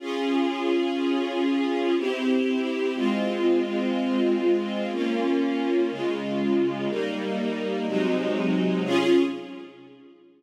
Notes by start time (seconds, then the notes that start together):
0.00 C#4 F4 G#4
1.97 C4 E4 G4
2.95 G#3 C4 F4
4.92 A#3 C#4 F4
5.90 C#3 G#3 F4
6.89 G3 A#3 D#4
7.87 C3 F#3 G#3 D#4
8.85 C#4 F4 G#4